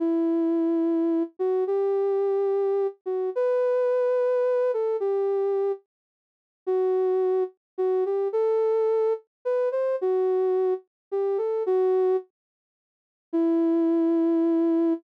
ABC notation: X:1
M:6/8
L:1/8
Q:3/8=72
K:Em
V:1 name="Ocarina"
E5 F | G5 F | B5 A | G3 z3 |
F3 z F G | A3 z B c | F3 z G A | F2 z4 |
E6 |]